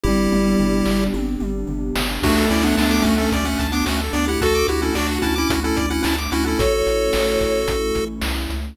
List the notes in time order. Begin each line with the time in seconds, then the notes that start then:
0.04 G1 G3 B3 D4 E4 G4, kick, high tom
0.32 G1, mid tom
0.59 G1, floor tom
0.86 G1, snare
1.14 G1, high tom
1.40 G1, mid tom
1.67 G1, floor tom
1.95 G1, snare
2.23 D2 A3 D4 F#4, kick, crash
2.38 A4
2.50 D2 C#4 E4 D5
2.63 B3 D4 F#5
2.77 D2 B3 D4 A5, snare
2.91 D6
3.02 D2 A3 C#4 F#4, kick, closed hi-hat
3.18 A3 C#4 A4
3.32 D2 D5, kick, closed hi-hat
3.45 A3 C#4 F#5
3.59 D2 A5, kick, closed hi-hat
3.72 B3 D4 D6
3.86 D2 A3 C#4 F#4, snare
4.01 A4
4.13 D2 B3 D4 D5, closed hi-hat
4.28 E4 G4 F#5
4.41 D2 F#4 A4 A5, kick, closed hi-hat
4.55 D6
4.68 D2 E4 F#4 G4, closed hi-hat
4.82 C#4 E4 A4
4.95 D2 D4 F#4 D5, snare
5.11 F#5
5.22 D2 C#4 E4 A5, kick, closed hi-hat
5.36 C#4 E4 D6
5.50 D2 F#4, kick, closed hi-hat
5.64 C#4 E4 A4
5.77 D2 D5, kick, closed hi-hat
5.90 C#4 E4 F#5
6.03 D2 C#4 E4 A5, snare
6.18 D6
6.32 D2 C#4 E4 F#4, closed hi-hat
6.46 C#4 E4 A4
6.59 A1 A3 C#4 E4 F#4 A4 C#5, kick, closed hi-hat
6.73 C#5
6.87 A1, closed hi-hat
7.13 A1, snare
7.40 A1, kick, closed hi-hat
7.68 A1, kick, closed hi-hat
7.95 A1, kick, closed hi-hat
8.21 C2, snare
8.50 C#2, closed hi-hat